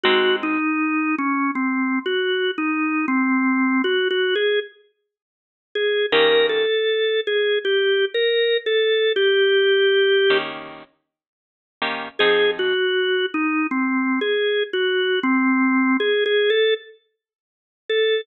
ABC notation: X:1
M:4/4
L:1/8
Q:1/4=79
K:Eb
V:1 name="Drawbar Organ"
_G E2 _D (3C2 G2 E2 | C2 (3_G G A z3 A | B =A2 _A (3G2 B2 =A2 | G4 z4 |
A _G2 E (3C2 A2 G2 | C2 (3A A =A z3 A |]
V:2 name="Acoustic Guitar (steel)"
[A,CE_G]8- | [A,CE_G]8 | [E,B,_DG]8- | [E,B,_DG]3 [E,B,DG]4 [E,B,DG] |
[F,CEA]8- | [F,CEA]8 |]